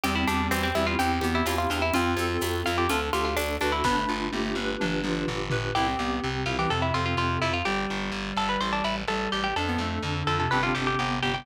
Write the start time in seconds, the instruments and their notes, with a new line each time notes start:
0.03 electric bass (finger) E2, clarinet G3, electric piano 2 C4, harpsichord G4, cowbell, low conga, shaker
0.15 harpsichord E4
0.27 electric bass (finger) E2, harpsichord D4, electric piano 2 G4, high conga, shaker
0.51 electric bass (finger) E2, electric piano 2 C4, harpsichord C4, tambourine, cowbell, high conga, shaker
0.63 harpsichord C4
0.75 electric bass (finger) E2, clarinet G3, electric piano 2 E4, harpsichord E4, high conga, shaker
0.87 harpsichord F4
0.99 electric bass (finger) E2, clarinet C4, electric piano 2 C4, harpsichord G4, cowbell, low conga, shaker
1.21 electric bass (finger) E2, clarinet B3, electric piano 2 G4, high conga, shaker
1.35 harpsichord E4
1.46 electric bass (finger) E2, electric piano 2 E4, harpsichord F4, tambourine, cowbell, high conga, shaker
1.58 harpsichord F4
1.70 electric bass (finger) E2, electric piano 2 C4, clarinet D4, harpsichord F4, shaker
1.82 harpsichord E4
1.94 electric bass (finger) F2, electric piano 2 C4, clarinet F4, harpsichord F4, cowbell, low conga, shaker
2.16 electric bass (finger) F2, electric piano 2 A4, high conga, shaker
2.41 electric bass (finger) F2, electric piano 2 C4, tambourine, cowbell, high conga, shaker
2.65 electric bass (finger) F2, clarinet F4, harpsichord F4, electric piano 2 F4, shaker
2.78 harpsichord G4
2.89 electric bass (finger) D2, electric piano 2 D4, harpsichord F4, clarinet A4, cowbell, low conga, shaker
3.12 electric bass (finger) D2, harpsichord F4, clarinet G4, electric piano 2 A4, high conga, shaker
3.25 harpsichord F4
3.36 electric bass (finger) D2, electric piano 2 D4, harpsichord D4, tambourine, cowbell, high conga, shaker
3.61 electric bass (finger) D2, harpsichord D4, electric piano 2 F#4, clarinet B4, high conga, shaker
3.72 harpsichord E4
3.84 electric bass (finger) G1, clarinet B3, electric piano 2 D4, harpsichord B4, kick, snare
3.96 clarinet A3
4.08 electric bass (finger) G1, electric piano 2 F4
4.32 electric bass (finger) G1, clarinet A3, electric piano 2 G4, high tom
4.44 clarinet A3
4.55 electric bass (finger) G1, electric piano 2 B4, high tom
4.80 electric bass (finger) G1, electric piano 2 D4, clarinet D4, mid tom
5.04 electric bass (finger) G1, electric piano 2 F4, mid tom
5.27 electric bass (finger) G1, electric piano 2 G4, floor tom
5.50 electric bass (finger) G1, electric piano 2 B4, floor tom
5.75 electric bass (finger) C2, electric piano 2 C4, clarinet E4, harpsichord G4
5.87 clarinet C4
5.99 electric bass (finger) C2, clarinet B3, electric piano 2 G4
6.22 electric bass (finger) C2, clarinet C3, electric piano 2 C4
6.46 electric bass (finger) C2, electric piano 2 E4, harpsichord F4
6.58 clarinet E3, harpsichord G4
6.70 electric bass (finger) F2, clarinet C3, electric piano 2 C4, harpsichord A4
6.82 harpsichord E4
6.94 electric bass (finger) F2, harpsichord F4, electric piano 2 A4
7.06 harpsichord F4
7.17 electric bass (finger) F2, electric piano 2 C4, harpsichord F4
7.41 electric bass (finger) F2, harpsichord E4, electric piano 2 F4
7.54 harpsichord F4
7.65 electric bass (finger) G1, clarinet G3, harpsichord G4
7.90 electric bass (finger) G1
8.12 electric bass (finger) G1
8.37 electric bass (finger) G1, harpsichord A4
8.49 harpsichord B4
8.61 electric bass (finger) A1, harpsichord C5
8.73 harpsichord D4
8.84 electric bass (finger) A1, harpsichord E4
9.08 electric bass (finger) A1, clarinet G3, harpsichord A4
9.32 electric bass (finger) A1, harpsichord G4
9.44 harpsichord G4
9.56 electric bass (finger) F2, electric piano 2 D4, clarinet D4, harpsichord A4
9.67 clarinet B3
9.78 electric bass (finger) F2, clarinet A3, electric piano 2 A4
10.03 electric bass (finger) F2, clarinet D3, electric piano 2 D4
10.27 electric bass (finger) F2, electric piano 2 F4, harpsichord A4
10.40 clarinet C3, harpsichord A4
10.51 electric bass (finger) G1, clarinet C3, electric piano 2 C4 D4 G4, harpsichord B4
10.63 harpsichord F4
10.75 electric bass (finger) G1, harpsichord G4
10.87 harpsichord G4
10.99 electric bass (finger) G1, electric piano 2 B3, harpsichord G4
11.23 electric bass (finger) G1, harpsichord G4, electric piano 2 G4
11.34 harpsichord G4